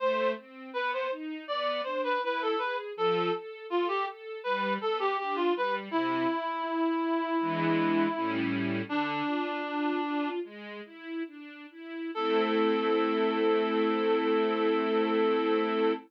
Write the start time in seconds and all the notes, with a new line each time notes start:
0.00 A3 C5
0.37 C4
0.73 B3 B4
0.93 C5
1.11 D#4
1.48 B3 D5
1.84 D4 C5
2.04 B4
2.22 E4 B4
2.42 A4
2.58 G#4 B4
2.96 F3 A4
3.33 A4
3.70 F4 A4
3.88 G4
4.07 A4
4.44 G3 B4
4.81 B3 A4
4.99 G4
5.19 D4 G4
5.36 F4
5.56 G3 B4
5.91 C3 E4
6.29 E4
6.67 E4
7.04 E4
7.41 E3 G#3 B3 D4
8.15 A2 G3 C#4 E4
8.89 D3 D4
9.27 F4
9.65 F4
10.03 F4
10.44 G#3
10.85 E4
11.27 D4
11.71 E4
12.15 A3 C4 E4 A4